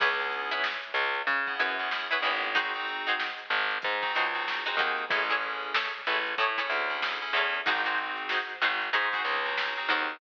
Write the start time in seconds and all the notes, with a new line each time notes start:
0.00 C#2 B3 C#4 E4 G#4 B4 C#5, kick, crash
0.19 B3 C#4 E4 G#4, closed hi-hat
0.32 closed hi-hat
0.51 E4 G#4 B4 C#5, closed hi-hat
0.64 snare
0.83 snare, closed hi-hat
0.94 C#2, closed hi-hat
1.14 snare, closed hi-hat
1.27 C#3, kick, closed hi-hat
1.47 B3 C#4 E4 G#4, kick, closed hi-hat
1.60 F#2 E4 G#4 B4 C#5, closed hi-hat
1.79 B3 C#4 E4 G#4, closed hi-hat
1.91 B3 C#4 E4 G#4, snare
2.11 B3 C#4 E4 G#4 B4 C#5, closed hi-hat
2.22 G#1 E4 G#4 B4 C#5, closed hi-hat
2.43 open hi-hat
2.55 C4 D#4 F#4 G#4 C5, kick, closed hi-hat
2.74 C4 D#4 F#4 G#4, closed hi-hat
2.88 closed hi-hat
3.06 D#4 F#4 G#4 C5, snare, closed hi-hat
3.20 snare
3.38 closed hi-hat
3.50 G#1, closed hi-hat
3.70 snare, closed hi-hat
3.82 G#2, kick, closed hi-hat
4.02 C4 D#4 F#4 G#4, kick, closed hi-hat
4.15 C#2 D#4 F#4 G#4 C5, closed hi-hat
4.34 C4 D#4 F#4 G#4, closed hi-hat
4.47 C4 D#4 F#4 G#4, snare
4.65 C4 D#4 F#4 G#4 C5, closed hi-hat
4.77 D#2 D#4 F#4 G#4, kick, closed hi-hat
4.81 C5
4.98 closed hi-hat
5.10 A1 C#4 E4 G#4 A4 C#5, kick, closed hi-hat
5.30 C#4 E4 G#4 A4 C#5, closed hi-hat
5.42 closed hi-hat
5.62 closed hi-hat
5.74 E4 G#4 A4 C#5, snare
5.93 closed hi-hat
6.06 A1 E4 G#4 A4 C#5, closed hi-hat
6.26 closed hi-hat
6.38 A2 E4 G#4 A4 C#5, kick, closed hi-hat
6.58 C#4 E4 G#4 A4 C#5, kick, closed hi-hat
6.70 D2, closed hi-hat
6.89 C#4 E4 G#4 A4, closed hi-hat
7.02 C#4 E4 G#4 A4, snare
7.21 C#4 E4 G#4 A4, closed hi-hat
7.33 E2 E4 G#4 A4 C#5, closed hi-hat
7.54 closed hi-hat
7.66 G#1 C4 D#4 F#4 G#4 C5, kick, closed hi-hat
7.85 C4 D#4 F#4 G#4 C5, snare, closed hi-hat
7.98 closed hi-hat
8.17 closed hi-hat
8.29 D#4 F#4 G#4 C5, snare
8.49 closed hi-hat
8.62 G#1 D#4 F#4 G#4 C5, closed hi-hat
8.81 snare, closed hi-hat
8.93 G#2 D#4 F#4 G#4 C5, kick, closed hi-hat
9.12 C4 D#4 F#4 G#4 C5, kick, snare, closed hi-hat
9.25 C#2, closed hi-hat
9.45 C4 D#4 F#4 G#4, closed hi-hat
9.57 C4 D#4 F#4 G#4, snare
9.76 C4 D#4 F#4 G#4, closed hi-hat
9.89 D#2 D#4 F#4 G#4 C5, kick, closed hi-hat
10.10 closed hi-hat